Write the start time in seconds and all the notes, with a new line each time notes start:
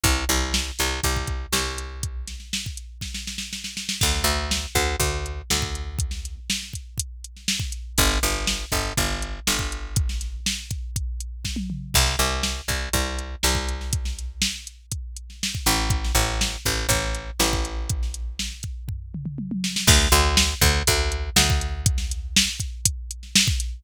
0.04 C2, kick, closed hi-hat
0.29 C2, snare, closed hi-hat
0.54 snare
0.79 C2, snare, closed hi-hat
1.04 C2, kick, closed hi-hat
1.16 kick
1.27 kick, closed hi-hat
1.52 C2, snare
1.67 snare
1.78 closed hi-hat
2.03 kick, closed hi-hat
2.27 snare, closed hi-hat
2.40 snare
2.53 snare
2.66 kick
2.77 closed hi-hat
3.01 kick, snare
3.14 snare
3.27 snare
3.38 snare
3.53 snare
3.64 snare
3.77 snare
3.89 snare
4.01 D2, kick, crash
4.15 snare
4.24 D2, closed hi-hat
4.51 snare
4.75 D2, kick, closed hi-hat
5.00 D2, kick, closed hi-hat
5.26 closed hi-hat
5.50 D2, snare
5.62 kick
5.75 closed hi-hat
5.99 kick, closed hi-hat
6.11 snare
6.25 closed hi-hat
6.50 snare
6.63 snare
6.73 kick, closed hi-hat
6.98 kick, closed hi-hat
7.24 closed hi-hat
7.36 snare
7.48 snare
7.60 kick, snare
7.72 closed hi-hat
7.98 G1, kick, closed hi-hat
8.11 snare
8.23 G1, closed hi-hat
8.47 snare
8.60 snare
8.72 G1, kick, closed hi-hat
8.97 G1, kick, closed hi-hat
9.22 closed hi-hat
9.47 G1, snare
9.59 kick
9.72 closed hi-hat
9.96 kick, closed hi-hat
10.09 snare
10.21 snare, closed hi-hat
10.46 snare
10.71 kick, closed hi-hat
10.96 kick, closed hi-hat
11.20 closed hi-hat
11.45 kick, snare
11.56 high tom
11.70 mid tom
11.94 C2, kick, crash
12.07 snare
12.19 C2, closed hi-hat
12.43 snare
12.68 C2, kick, closed hi-hat
12.93 C2, kick, closed hi-hat
13.19 closed hi-hat
13.43 C2, snare
13.55 kick
13.68 closed hi-hat
13.81 snare
13.93 kick, closed hi-hat
14.05 snare
14.19 closed hi-hat
14.42 snare
14.67 closed hi-hat
14.92 kick, closed hi-hat
15.17 closed hi-hat
15.30 snare
15.43 snare
15.55 kick
15.66 A1, snare, closed hi-hat
15.90 kick, closed hi-hat
16.04 snare
16.15 A1, closed hi-hat
16.28 snare
16.41 snare
16.65 A1, kick, closed hi-hat
16.89 A1, kick, closed hi-hat
17.02 snare
17.15 closed hi-hat
17.39 A1, snare
17.53 kick
17.65 closed hi-hat
17.89 kick, closed hi-hat
18.03 snare
18.14 closed hi-hat
18.39 snare
18.63 kick, closed hi-hat
18.88 kick, floor tom
19.14 mid tom
19.26 mid tom
19.38 high tom
19.51 high tom
19.64 snare
19.76 snare
19.87 D2, kick, crash
20.01 snare
20.12 D2, closed hi-hat
20.37 snare
20.61 D2, kick, closed hi-hat
20.87 D2, kick, closed hi-hat
21.12 closed hi-hat
21.36 D2, snare
21.50 kick
21.61 closed hi-hat
21.86 kick, closed hi-hat
21.98 snare
22.11 closed hi-hat
22.36 snare
22.50 snare
22.60 kick, closed hi-hat
22.85 kick, closed hi-hat
23.11 closed hi-hat
23.23 snare
23.36 snare
23.48 kick, snare
23.60 closed hi-hat